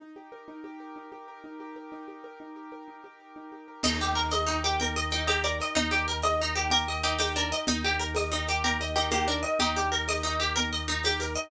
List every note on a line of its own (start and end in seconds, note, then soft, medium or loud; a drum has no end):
0.00 0.47 D#4 medium
0.16 0.64 G4 soft
0.32 0.79 A#4 medium
0.48 0.96 D#4 medium
0.64 1.11 G4 medium
0.80 1.28 A#4 medium
0.96 1.43 D#4 medium
1.12 1.60 G4 medium
1.28 1.76 A#4 medium
1.44 1.92 D#4 medium
1.60 2.07 G4 medium
1.76 2.23 A#4 medium
1.92 2.40 D#4 medium
2.08 2.56 G4 medium
2.24 2.71 A#4 medium
2.40 2.87 D#4 soft
2.56 3.03 G4 medium
2.72 3.19 A#4 medium
2.88 3.36 D#4 soft
3.04 3.51 G4 medium
3.20 3.68 A#4 soft
3.36 3.82 D#4 medium
3.52 3.82 G4 medium
3.68 3.83 A#4 medium
3.83 5.61 D#2 loud
3.83 3.99 D#4 medium
3.83 4.32 D#4 medium
3.83 4.69 D#5 medium
3.83 crash loud
3.83 low conga loud
4.00 4.47 G4 medium
4.00 4.16 G4 soft
4.00 shaker medium
4.15 4.30 A#4 medium
4.15 4.63 A#4 medium
4.15 shaker medium
4.30 4.80 D#4 medium
4.30 4.46 D#5 medium
4.30 tambourine medium
4.30 high conga loud
4.30 shaker medium
4.47 4.61 D#4 medium
4.47 4.96 G4 medium
4.47 shaker medium
4.64 4.79 G4 medium
4.64 5.11 A#4 medium
4.64 shaker medium
4.80 5.28 D#4 medium
4.80 4.96 A#4 medium
4.80 5.10 G5 medium
4.80 low conga medium
4.80 shaker medium
4.96 5.44 G4 medium
4.96 5.11 D#5 medium
4.96 shaker medium
5.10 5.27 D#4 soft
5.10 5.60 A#4 medium
5.10 5.26 G5 medium
5.10 shaker medium
5.27 5.75 D#4 medium
5.27 5.43 G4 medium
5.27 5.43 D#5 medium
5.27 tambourine medium
5.27 high conga loud
5.27 shaker medium
5.44 5.92 G4 medium
5.44 5.58 A#4 medium
5.44 5.59 D5 medium
5.44 shaker medium
5.60 6.07 A#4 medium
5.60 5.76 D#5 medium
5.60 shaker medium
5.75 7.53 D#2 loud
5.75 5.90 D#4 medium
5.75 6.24 D#4 medium
5.75 6.57 D#4 loud
5.75 low conga loud
5.75 shaker medium
5.91 6.06 G4 medium
5.91 6.39 G4 medium
5.91 shaker medium
6.08 6.22 A#4 medium
6.08 6.56 A#4 medium
6.08 shaker medium
6.22 6.71 D#4 medium
6.22 6.38 D#5 medium
6.22 tambourine medium
6.22 high conga medium
6.22 shaker medium
6.40 6.56 D#4 medium
6.40 6.87 G4 medium
6.40 shaker medium
6.55 6.70 G4 medium
6.55 7.04 A#4 medium
6.55 shaker medium
6.70 7.20 D#4 medium
6.70 6.97 G4 medium
6.70 6.87 A#4 medium
6.70 low conga medium
6.70 shaker medium
6.88 7.36 G4 medium
6.88 7.03 D#5 medium
6.88 shaker medium
7.03 7.18 D#4 medium
7.03 7.17 G4 medium
7.03 7.52 A#4 medium
7.03 shaker medium
7.19 7.34 D#4 medium
7.19 7.66 D#4 medium
7.19 7.33 G4 medium
7.19 tambourine loud
7.19 high conga loud
7.19 shaker medium
7.36 7.50 D4 medium
7.36 7.66 G4 medium
7.36 7.52 A#4 medium
7.36 shaker medium
7.52 7.67 A#4 medium
7.52 7.67 D#5 medium
7.52 shaker medium
7.67 9.45 D#2 loud
7.67 7.82 D#4 medium
7.67 8.57 D#4 medium
7.67 8.16 D#4 medium
7.67 low conga loud
7.67 shaker medium
7.84 8.32 G4 medium
7.84 7.99 G4 medium
7.84 shaker medium
7.99 8.14 A#4 medium
7.99 8.47 A#4 medium
7.99 shaker medium
8.15 8.63 D#4 medium
8.15 8.31 D#5 medium
8.15 tambourine medium
8.15 high conga loud
8.15 shaker medium
8.32 8.46 D#4 medium
8.32 8.79 G4 medium
8.32 shaker medium
8.47 8.63 G4 medium
8.47 8.96 A#4 medium
8.47 shaker medium
8.64 9.12 D#4 medium
8.64 8.90 G4 medium
8.64 8.79 A#4 medium
8.64 low conga medium
8.64 shaker medium
8.80 9.27 G4 medium
8.80 8.96 D#5 medium
8.80 shaker medium
8.95 9.11 D#4 medium
8.95 9.09 G4 medium
8.95 9.43 A#4 medium
8.95 shaker medium
9.11 9.27 A#3 medium
9.11 9.59 D#4 medium
9.11 9.27 G4 medium
9.11 tambourine medium
9.11 high conga medium
9.11 shaker loud
9.28 9.42 D4 medium
9.28 9.75 G4 medium
9.28 9.43 A#4 medium
9.28 shaker medium
9.43 9.91 A#4 medium
9.43 9.57 D#5 medium
9.43 shaker medium
9.59 11.37 D#2 medium
9.59 10.07 D#4 medium
9.59 9.75 D#4 medium
9.59 10.16 G4 loud
9.59 low conga loud
9.59 shaker medium
9.76 10.24 G4 medium
9.76 9.91 G4 medium
9.76 shaker medium
9.92 10.06 A#4 medium
9.92 10.39 A#4 medium
9.92 shaker medium
10.08 10.55 D#4 medium
10.08 10.23 D#5 medium
10.08 tambourine medium
10.08 high conga medium
10.08 shaker medium
10.23 10.38 D#4 medium
10.23 10.71 G4 medium
10.23 shaker medium
10.40 10.54 G4 medium
10.40 10.88 A#4 medium
10.40 shaker medium
10.56 11.04 D#4 medium
10.56 10.70 A#4 medium
10.56 low conga loud
10.56 shaker medium
10.72 11.19 G4 medium
10.72 10.87 D#5 medium
10.72 shaker medium
10.88 11.03 D#4 medium
10.88 11.35 A#4 medium
10.88 shaker medium
11.03 11.50 D#4 medium
11.03 11.20 G4 medium
11.03 tambourine medium
11.03 high conga medium
11.03 shaker medium
11.20 11.50 G4 medium
11.20 11.35 A#4 soft
11.20 shaker medium
11.34 11.50 A#4 medium
11.34 11.50 D#5 medium
11.34 shaker medium